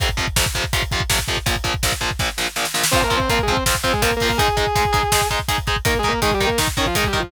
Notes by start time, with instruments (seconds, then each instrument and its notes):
0.00 overdriven guitar F2 C3 F3, kick, closed hi-hat
0.09 kick
0.17 overdriven guitar F2 C3 F3, kick, closed hi-hat
0.27 kick
0.36 overdriven guitar F2 C3 F3, kick, snare
0.46 kick
0.55 overdriven guitar F2 C3 F3, kick, closed hi-hat
0.64 kick
0.73 overdriven guitar F2 C3 F3, kick, closed hi-hat
0.82 kick
0.91 overdriven guitar F2 C3 F3, kick, closed hi-hat
1.00 kick
1.10 overdriven guitar F2 C3 F3, kick, snare
1.19 kick
1.28 overdriven guitar F2 C3 F3, kick, closed hi-hat
1.37 kick
1.46 overdriven guitar A#1 A#2 F3, kick, closed hi-hat
1.56 kick
1.64 overdriven guitar A#1 A#2 F3, kick, closed hi-hat
1.74 kick
1.83 overdriven guitar A#1 A#2 F3, kick, snare
1.92 kick
2.01 overdriven guitar A#1 A#2 F3, kick, closed hi-hat
2.11 kick
2.19 overdriven guitar A#1 A#2 F3, kick, snare
2.38 overdriven guitar A#1 A#2 F3, snare
2.56 overdriven guitar A#1 A#2 F3, snare
2.65 snare
2.74 overdriven guitar A#1 A#2 F3, snare
2.84 snare
2.91 overdriven guitar F3 C4 F4, distortion guitar C4 C5, kick, crash
3.02 distortion guitar A#3 A#4, kick
3.10 overdriven guitar F3 C4 F4, kick, closed hi-hat
3.17 distortion guitar C4 C5, kick
3.29 overdriven guitar F3 C4 F4, distortion guitar A#3 A#4, kick, closed hi-hat
3.39 distortion guitar G#3 G#4, kick
3.48 overdriven guitar F3 C4 F4, kick, closed hi-hat
3.52 distortion guitar C4 C5
3.57 kick
3.66 overdriven guitar F3 C4 F4, kick, snare
3.75 kick
3.84 overdriven guitar F3 C4 F4, distortion guitar C4 C5, kick, closed hi-hat
3.93 distortion guitar G#3 G#4, kick
4.02 overdriven guitar F3 C4 F4, distortion guitar A#3 A#4, kick, closed hi-hat
4.11 kick
4.17 distortion guitar A#3 A#4, open hi-hat
4.21 overdriven guitar F3 C4 F4, kick
4.29 distortion guitar A#3 A#4, kick
4.38 overdriven guitar G#3 D#4 G#4, distortion guitar G#4 G#5, kick, closed hi-hat
4.48 kick
4.57 overdriven guitar G#3 D#4 G#4, kick, closed hi-hat
4.67 kick
4.75 overdriven guitar G#3 D#4 G#4, kick, closed hi-hat
4.85 kick
4.93 overdriven guitar G#3 D#4 G#4, kick, closed hi-hat
5.03 kick
5.12 overdriven guitar G#3 D#4 G#4, kick, snare
5.21 kick
5.30 overdriven guitar G#3 D#4 G#4, kick, closed hi-hat
5.39 kick
5.48 overdriven guitar G#3 D#4 G#4, kick, closed hi-hat
5.58 kick
5.67 overdriven guitar G#3 D#4 G#4, kick, closed hi-hat
5.76 kick
5.85 overdriven guitar D#3 D#4 A#4, distortion guitar A#3 A#4, kick, closed hi-hat
5.95 kick
5.99 distortion guitar G#3 G#4
6.03 overdriven guitar D#3 D#4 A#4, kick, closed hi-hat
6.08 distortion guitar A#3 A#4
6.13 kick
6.22 overdriven guitar D#3 D#4 A#4, distortion guitar G#3 G#4, kick, closed hi-hat
6.32 distortion guitar G3 G4, kick
6.40 overdriven guitar D#3 D#4 A#4, kick, closed hi-hat
6.47 distortion guitar A#3 A#4, kick
6.58 overdriven guitar D#3 D#4 A#4, kick, snare
6.68 kick
6.77 overdriven guitar D#3 D#4 A#4, distortion guitar C#4 C#5, kick, closed hi-hat
6.86 distortion guitar F3 F4, kick
6.95 overdriven guitar D#3 D#4 A#4, distortion guitar G#3 G#4, kick, closed hi-hat
7.04 distortion guitar G3 G4, kick
7.13 overdriven guitar D#3 D#4 A#4, kick, closed hi-hat
7.20 distortion guitar F3 F4, kick